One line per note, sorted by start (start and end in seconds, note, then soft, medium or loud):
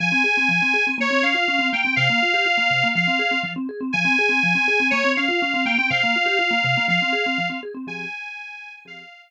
0.00 0.12 F3 loud
0.00 0.85 G#5 medium
0.12 0.23 C4 medium
0.24 0.35 G#4 medium
0.37 0.48 C4 medium
0.49 0.60 F3 medium
0.62 0.73 C4 medium
0.74 0.85 G#4 medium
0.87 0.98 C4 medium
0.98 1.09 A#3 loud
0.98 1.24 C#5 medium
1.11 1.22 C4 medium
1.22 1.34 C#4 medium
1.22 1.69 F5 medium
1.34 1.46 F4 medium
1.48 1.59 C#4 medium
1.59 1.70 C4 medium
1.73 1.84 A#3 medium
1.73 1.94 G5 medium
1.85 1.96 C4 medium
1.96 2.08 C3 loud
1.96 2.88 F5 medium
2.10 2.21 A#3 medium
2.22 2.34 F4 medium
2.34 2.45 G4 medium
2.46 2.57 F4 medium
2.58 2.69 A#3 medium
2.71 2.82 C3 medium
2.84 2.95 A#3 medium
2.95 3.07 F3 loud
2.95 3.40 F5 medium
3.07 3.19 C4 medium
3.19 3.30 G#4 medium
3.31 3.42 C4 medium
3.43 3.55 F3 loud
3.56 3.67 C4 medium
3.69 3.80 G#4 medium
3.81 3.92 C4 medium
3.93 4.05 F3 loud
3.93 4.88 G#5 medium
4.05 4.16 C4 loud
4.19 4.30 G#4 loud
4.29 4.40 C4 loud
4.43 4.55 F3 loud
4.55 4.66 C4 loud
4.68 4.79 G#4 loud
4.80 4.91 C4 medium
4.90 5.03 A#3 loud
4.90 5.12 C#5 medium
5.05 5.16 C4 loud
5.17 5.28 C#4 medium
5.17 5.64 F5 medium
5.29 5.40 F4 loud
5.42 5.53 C#4 loud
5.54 5.65 C4 loud
5.66 5.77 A#3 loud
5.66 5.89 G5 medium
5.78 5.90 C4 medium
5.90 6.02 C3 loud
5.90 6.86 F5 medium
6.03 6.15 A#3 loud
6.16 6.27 F4 medium
6.26 6.37 G4 loud
6.39 6.50 F4 loud
6.51 6.62 A#3 loud
6.64 6.75 C3 loud
6.77 6.89 A#3 loud
6.88 6.99 F3 loud
6.88 7.48 F5 medium
7.02 7.13 C4 loud
7.13 7.24 G#4 loud
7.26 7.38 C4 loud
7.38 7.49 F3 loud
7.50 7.61 C4 loud
7.63 7.74 G#4 medium
7.74 7.86 C4 loud
7.87 8.05 F3 medium
7.87 8.05 C4 medium
7.87 8.05 G4 medium
7.87 8.05 G#4 medium
7.87 8.73 G#5 medium
8.85 9.03 F3 medium
8.85 9.03 C4 medium
8.85 9.03 G4 medium
8.85 9.03 G#4 medium
8.85 9.22 F5 medium